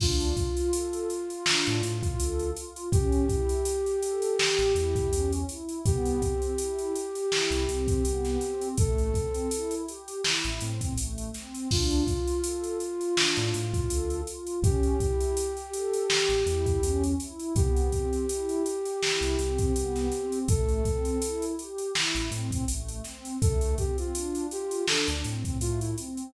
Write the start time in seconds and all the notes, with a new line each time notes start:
0.00 D2 D4 F4, kick, crash
0.20 closed hi-hat
0.37 F4, kick, closed hi-hat
0.57 closed hi-hat
0.73 A4, closed hi-hat
0.93 closed hi-hat
1.10 F4, closed hi-hat
1.30 closed hi-hat
1.46 D4, snare
1.66 A2, closed hi-hat
1.82 A2 F4, closed hi-hat
2.03 kick, closed hi-hat
2.19 D2 A4, closed hi-hat
2.39 closed hi-hat
2.56 F4, closed hi-hat
2.76 closed hi-hat
2.92 A1 C#4 G4, kick, closed hi-hat
3.12 closed hi-hat
3.28 E4, kick, closed hi-hat
3.49 closed hi-hat
3.65 G4, closed hi-hat
3.86 closed hi-hat
4.02 A4, closed hi-hat
4.22 closed hi-hat
4.39 G4, snare
4.59 A1, closed hi-hat
4.75 E2 E4, closed hi-hat
4.96 kick, closed hi-hat
5.11 E2 C#4, closed hi-hat
5.32 closed hi-hat
5.48 E4, closed hi-hat
5.69 closed hi-hat
5.85 C2 B3 G4, kick, closed hi-hat
6.05 closed hi-hat
6.20 C4, kick, closed hi-hat
6.42 closed hi-hat
6.58 E4, closed hi-hat
6.79 closed hi-hat
6.93 G4, closed hi-hat
7.15 closed hi-hat
7.31 E4, snare
7.51 C2, closed hi-hat
7.68 C2 C4, closed hi-hat
7.88 kick, closed hi-hat
8.04 C2 B3, closed hi-hat
8.25 snare, closed hi-hat
8.41 C4, closed hi-hat
8.61 closed hi-hat
8.77 A1 A3 A4, kick, closed hi-hat
8.98 closed hi-hat
9.14 C4, kick, closed hi-hat
9.34 closed hi-hat
9.51 E4, closed hi-hat
9.71 closed hi-hat
9.88 G4, closed hi-hat
10.08 closed hi-hat
10.24 E4, snare
10.44 A1, closed hi-hat
10.59 A2 C4, closed hi-hat
10.81 kick, closed hi-hat
10.96 A1 A3, closed hi-hat
11.18 closed hi-hat
11.34 C4, snare, closed hi-hat
11.55 closed hi-hat
11.70 D2 D4 F4, kick, crash
11.91 closed hi-hat
12.07 F4, kick, closed hi-hat
12.27 closed hi-hat
12.44 A4, closed hi-hat
12.64 closed hi-hat
12.80 F4, closed hi-hat
13.01 closed hi-hat
13.15 D4, snare
13.36 A2, closed hi-hat
13.54 A2 F4, closed hi-hat
13.74 kick, closed hi-hat
13.89 D2 A4, closed hi-hat
14.10 closed hi-hat
14.27 F4, closed hi-hat
14.47 closed hi-hat
14.62 A1 C#4 G4, kick, closed hi-hat
14.83 closed hi-hat
15.00 E4, kick, closed hi-hat
15.20 closed hi-hat
15.37 G4, closed hi-hat
15.57 closed hi-hat
15.73 A4, closed hi-hat
15.93 closed hi-hat
16.10 G4, snare
16.29 A1, closed hi-hat
16.46 E2 E4, closed hi-hat
16.66 kick, closed hi-hat
16.82 E2 C#4, closed hi-hat
17.04 closed hi-hat
17.20 E4, closed hi-hat
17.39 closed hi-hat
17.55 C2 B3 G4, kick, closed hi-hat
17.77 closed hi-hat
17.92 C4, kick, closed hi-hat
18.13 closed hi-hat
18.29 E4, closed hi-hat
18.49 closed hi-hat
18.65 G4, closed hi-hat
18.85 closed hi-hat
19.03 E4, snare
19.21 C2, closed hi-hat
19.39 C2 C4, closed hi-hat
19.58 kick, closed hi-hat
19.74 C2 B3, closed hi-hat
19.96 snare, closed hi-hat
20.11 C4, closed hi-hat
20.32 closed hi-hat
20.48 A1 A3 A4, kick, closed hi-hat
20.68 closed hi-hat
20.85 C4, kick, closed hi-hat
21.05 closed hi-hat
21.22 E4, closed hi-hat
21.42 closed hi-hat
21.59 G4, closed hi-hat
21.78 closed hi-hat
21.95 E4, snare
22.15 A1, closed hi-hat
22.31 A2 C4, closed hi-hat
22.51 kick, closed hi-hat
22.68 A1 A3, closed hi-hat
22.88 closed hi-hat
23.04 C4, snare, closed hi-hat
23.25 closed hi-hat
23.41 D2 A3 A4, kick, closed hi-hat
23.61 closed hi-hat
23.78 C4 G4, kick, closed hi-hat
23.98 F4, closed hi-hat
24.14 D4, closed hi-hat
24.35 closed hi-hat
24.49 F4 G4, closed hi-hat
24.71 closed hi-hat
24.87 D4 A4, snare
25.08 D2, closed hi-hat
25.24 A2 C4, closed hi-hat
25.45 kick, closed hi-hat
25.59 A2 A3 F4, closed hi-hat
25.80 E4, closed hi-hat
25.98 C4, closed hi-hat
26.17 closed hi-hat